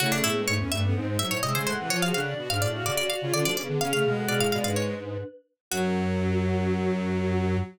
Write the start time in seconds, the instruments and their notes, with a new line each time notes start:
0.00 lead 1 (square) C#3, violin A3, choir aahs E4 C#5, harpsichord F#4
0.12 choir aahs C#4 A4, harpsichord D4
0.24 lead 1 (square) A2, choir aahs B3 G#4, harpsichord E4
0.35 violin G#3, choir aahs D4 B4
0.47 lead 1 (square) G#2, violin A3, harpsichord C#5
0.59 lead 1 (square) E2, choir aahs C#4 A4, violin C#4
0.71 lead 1 (square) G2, violin A3, choir aahs D4 B4, harpsichord E5
0.83 violin B3, choir aahs C#4 A4
0.95 lead 1 (square) G#2, violin C4, choir aahs D#4 C5
1.07 violin G#3, choir aahs D#4 C5
1.19 violin F#3, choir aahs D#4 C5, harpsichord E5
1.30 lead 1 (square) A2, choir aahs E4 C#5, harpsichord C#5
1.42 lead 1 (square) C3, violin G#3, choir aahs G#4 E5, harpsichord D#5
1.54 lead 1 (square) C#3, violin G#3, choir aahs C5 G#5, harpsichord C5
1.66 lead 1 (square) A2, choir aahs A4 F#5, harpsichord C5
1.79 lead 1 (square) C3, violin E3
1.89 lead 1 (square) F3, choir aahs F4 C#5, violin F4, harpsichord C#5
2.02 violin F#4, choir aahs G#4 F5, harpsichord F5
2.14 lead 1 (square) C#3, violin D4, choir aahs A4 F#5, harpsichord F5
2.26 choir aahs F#4 D5
2.37 lead 1 (square) B2, violin F#4
2.50 lead 1 (square) G#2, violin D4, choir aahs G#4 F5, harpsichord F5
2.62 lead 1 (square) A2, choir aahs F#4 D5, harpsichord D5
2.74 violin F#4, choir aahs G#4 F5
2.86 lead 1 (square) C#3, choir aahs F#4 D5, harpsichord D5
2.96 choir aahs F#4 D5, violin F#4, harpsichord D5
3.10 violin F#4, choir aahs F#4 D5, harpsichord F5
3.21 lead 1 (square) C#3, choir aahs F4 C#5, violin F4
3.33 lead 1 (square) D3, choir aahs C#4 A4, violin F4, harpsichord D5
3.45 lead 1 (square) F3, choir aahs A3 F#4, violin D4, harpsichord D5
3.57 lead 1 (square) C#3, choir aahs B3 G#4, harpsichord D5
3.69 lead 1 (square) D3
3.80 lead 1 (square) C#3, violin C#4, choir aahs G#4 F5, harpsichord F5
3.93 lead 1 (square) C#3, violin A3, harpsichord F5
4.05 lead 1 (square) B2, violin G#3
4.16 choir aahs A4 F#5
4.28 lead 1 (square) B2, choir aahs G#4 F5, harpsichord D5
4.40 lead 1 (square) A2, harpsichord F5
4.52 lead 1 (square) B2, choir aahs F#4 D5, harpsichord F5
4.64 lead 1 (square) G#2, choir aahs D4 B4, harpsichord F5
4.76 harpsichord C#5
5.71 lead 1 (square) F#2, violin F#3, choir aahs F#4, harpsichord F#4